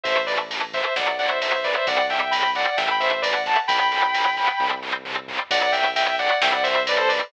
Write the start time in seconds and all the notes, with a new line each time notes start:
0.04 A1 E3 A3 C5 E5, kick, ride
0.26 E3 A3 B4 D5, ride
0.51 E3 A3, ride
0.73 E3 A3 C5 E5, kick, ride
0.96 B1 F#3 B3 D5 F#5, snare
1.19 F#3 B3 D5 F#5, ride
1.28 C5 E5
1.42 F#3 B3 C5 E5, ride
1.55 C5 E5
1.64 F#3 B3 B4 D5, kick, ride
1.75 C5 E5
1.87 C2 G3 C4 D5 F#5, kick, ride
2.10 G3 C4 E5 G5, ride
2.31 G3 C4 G5 B5, ride
2.55 G3 C4 D5 F#5, ride
2.77 A1 E3 A3 E5 G5, snare
2.91 G5 B5
3.00 E3 A3 C5 E5, ride
3.22 E3 A3 B4 D5, ride
3.33 D5 F#5
3.46 E3 A3 F#5 A5, kick, ride
3.68 B1 F#3 B3 G5 B5, kick, ride
3.92 F#3 B3, ride
4.14 F#3 B3, ride
4.37 F#3 B3, kick, ride
4.60 C2 G3 C4, kick
4.83 G3 C4
5.05 G3 C4, mid tom
5.28 G3 C4, floor tom
5.51 B1 F#3 B3 D5 F#5, kick, ride
5.72 F#3 B3 E5 G5, ride
5.96 F#3 B3 E5 G5, ride
6.19 F#3 B3 D5 F#5, ride
6.42 C2 G3 C4 E5 G5, snare
6.53 D5 F#5
6.63 G3 C4 C5 E5, ride
6.87 G3 C4 B4 D5, ride
6.98 A4 C5
7.08 G3 C4 B4 D5, ride